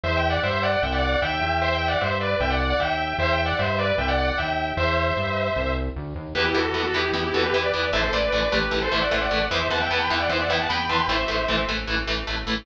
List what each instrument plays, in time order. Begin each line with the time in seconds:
0.04 synth bass 1 E2, distortion guitar C5 E5
0.17 distortion guitar E5 G5
0.30 distortion guitar D5 F#5
0.43 synth bass 1 G2, distortion guitar C5 E5
0.63 distortion guitar D5 F#5
0.83 synth bass 1 C2, distortion guitar E5 G5
0.92 distortion guitar D5 F#5
1.02 distortion guitar D5 F#5
1.12 distortion guitar D5 F#5
1.22 synth bass 1 D#2, distortion guitar E5 G5
1.41 synth bass 1 E2
1.62 distortion guitar C5 E5
1.75 distortion guitar E5 G5
1.88 distortion guitar D5 F#5
2.01 synth bass 1 G2, distortion guitar C5 E5
2.21 distortion guitar B4 D5
2.40 synth bass 1 C2, distortion guitar E5 G5
2.50 distortion guitar D5 F#5
2.60 distortion guitar D5 F#5
2.70 distortion guitar D5 F#5
2.80 synth bass 1 D#2, distortion guitar E5 G5
3.18 synth bass 1 E2, distortion guitar C5 E5
3.32 distortion guitar E5 G5
3.46 distortion guitar D5 F#5
3.59 synth bass 1 G2, distortion guitar C5 E5
3.78 distortion guitar B4 D5
3.98 synth bass 1 C2, distortion guitar E5 G5
4.08 distortion guitar D5 F#5
4.18 distortion guitar D5 F#5
4.28 distortion guitar D5 F#5
4.38 synth bass 1 D#2, distortion guitar E5 G5
4.77 synth bass 1 E2, distortion guitar C5 E5
5.16 synth bass 1 G2
5.56 synth bass 1 C2
5.96 synth bass 1 D2
6.16 synth bass 1 D#2
6.35 synth bass 1 E2, overdriven guitar E3 B3, distortion guitar G4 B4
6.45 distortion guitar E4 G4
6.55 synth bass 1 E2, overdriven guitar E3 B3, distortion guitar F#4 A4
6.74 synth bass 1 E2, overdriven guitar E3 B3
6.84 distortion guitar F#4 A4
6.94 synth bass 1 E2, overdriven guitar E3 B3, distortion guitar E4 G4
7.13 synth bass 1 E2, overdriven guitar E3 B3
7.24 distortion guitar E4 G4
7.34 synth bass 1 E2, overdriven guitar E3 B3, distortion guitar F#4 A4
7.44 distortion guitar G4 B4
7.53 synth bass 1 E2, overdriven guitar E3 B3, distortion guitar G4 B4
7.63 distortion guitar B4 D5
7.74 synth bass 1 E2, overdriven guitar E3 B3
7.93 synth bass 1 A1, overdriven guitar E3 A3, distortion guitar C5 E5
8.03 distortion guitar A4 C5
8.12 synth bass 1 A1, overdriven guitar E3 A3, distortion guitar B4 D5
8.32 synth bass 1 A1, overdriven guitar E3 A3
8.42 distortion guitar B4 D5
8.52 synth bass 1 A1, overdriven guitar E3 A3, distortion guitar G4 B4
8.71 synth bass 1 A1, overdriven guitar E3 A3
8.82 distortion guitar A4 C5
8.92 synth bass 1 A1, overdriven guitar E3 A3, distortion guitar C5 E5
9.02 distortion guitar D5 F#5
9.11 synth bass 1 A1, overdriven guitar E3 A3, distortion guitar C5 E5
9.21 distortion guitar D5 F#5
9.31 synth bass 1 A1, overdriven guitar E3 A3
9.51 synth bass 1 E2, overdriven guitar E3 B3, distortion guitar C5 E5
9.70 synth bass 1 E2, overdriven guitar E3 B3, distortion guitar F#5 A5
9.81 distortion guitar E5 G5
9.90 synth bass 1 E2, overdriven guitar E3 B3, distortion guitar F#5 A5
10.00 distortion guitar G5 B5
10.10 synth bass 1 E2, overdriven guitar E3 B3, distortion guitar E5 G5
10.20 distortion guitar D5 F#5
10.29 synth bass 1 E2, overdriven guitar E3 B3, distortion guitar C5 E5
10.40 distortion guitar D5 F#5
10.48 synth bass 1 E2, overdriven guitar E3 B3, distortion guitar E5 G5
10.60 distortion guitar F#5 A5
10.69 synth bass 1 E2, overdriven guitar E3 B3, distortion guitar G5 B5
10.89 synth bass 1 E2, overdriven guitar E3 B3, distortion guitar A5 C6
10.99 distortion guitar G5 B5
11.08 synth bass 1 A1, overdriven guitar E3 A3, distortion guitar C5 E5
11.28 synth bass 1 A1, overdriven guitar E3 A3
11.48 synth bass 1 A1, overdriven guitar E3 A3
11.69 synth bass 1 A1, overdriven guitar E3 A3
11.87 synth bass 1 A1, overdriven guitar E3 A3
12.07 synth bass 1 A1, overdriven guitar E3 A3
12.27 synth bass 1 A1, overdriven guitar E3 A3
12.46 synth bass 1 A1, overdriven guitar E3 A3